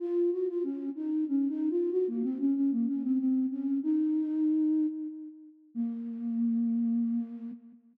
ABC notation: X:1
M:3/4
L:1/16
Q:1/4=94
K:Bbm
V:1 name="Flute"
F2 G F D2 E2 (3D2 E2 F2 | G B, C D D B, D C C2 D2 | E8 z4 | B,12 |]